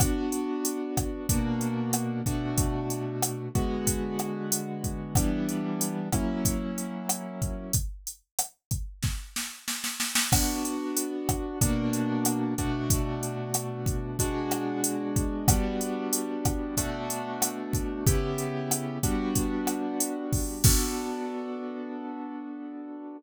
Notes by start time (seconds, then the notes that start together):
0.00 B3 D4 F#4, kick, cross-stick, closed hi-hat
0.32 closed hi-hat
0.65 closed hi-hat
0.97 kick, cross-stick, closed hi-hat
1.29 B2 A#3 D4 F#4, kick, closed hi-hat
1.61 closed hi-hat
1.93 cross-stick, closed hi-hat
2.26 B2 A3 D4 F#4, kick, closed hi-hat
2.58 kick, closed hi-hat
2.90 closed hi-hat
3.22 cross-stick, closed hi-hat
3.55 D3 G#3 B3 F#4, kick, closed hi-hat
3.87 kick, closed hi-hat
4.19 cross-stick, closed hi-hat
4.52 closed hi-hat
4.84 kick, closed hi-hat
5.15 E3 G3 B3 D4, kick, cross-stick, closed hi-hat
5.49 closed hi-hat
5.81 closed hi-hat
6.12 F#3 A#3 C#4 E4, kick, cross-stick, closed hi-hat
6.45 kick, closed hi-hat
6.78 closed hi-hat
7.09 cross-stick, closed hi-hat
7.42 kick, closed hi-hat
7.73 kick, closed hi-hat
8.07 closed hi-hat
8.39 cross-stick, closed hi-hat
8.71 kick, closed hi-hat
9.03 kick, snare
9.36 snare
9.68 snare
9.84 snare
10.00 snare
10.15 snare
10.32 B3 D4 F#4, kick, cross-stick, crash
10.65 closed hi-hat
10.97 closed hi-hat
11.29 kick, cross-stick, closed hi-hat
11.61 B2 A#3 D4 F#4, kick, closed hi-hat
11.93 closed hi-hat
12.25 cross-stick, closed hi-hat
12.58 B2 A3 D4 F#4, kick, closed hi-hat
12.90 kick, closed hi-hat
13.23 closed hi-hat
13.54 cross-stick, closed hi-hat
13.86 kick, closed hi-hat
14.19 B2 G#3 D4 F#4, kick, closed hi-hat
14.51 cross-stick, closed hi-hat
14.84 closed hi-hat
15.16 kick, closed hi-hat
15.48 G3 B3 D4 F#4, kick, cross-stick, closed hi-hat
15.81 closed hi-hat
16.13 closed hi-hat
16.45 kick, cross-stick, closed hi-hat
16.77 B2 A3 D4 F#4, kick, closed hi-hat
17.10 closed hi-hat
17.42 cross-stick, closed hi-hat
17.73 kick, closed hi-hat
18.06 C#3 B3 E4 G4, kick, closed hi-hat
18.38 closed hi-hat
18.71 cross-stick, closed hi-hat
19.03 G3 B3 D4 F#4, kick, closed hi-hat
19.35 kick, closed hi-hat
19.67 cross-stick, closed hi-hat
20.00 closed hi-hat
20.33 kick, open hi-hat
20.64 B3 D4 F#4 A4, kick, crash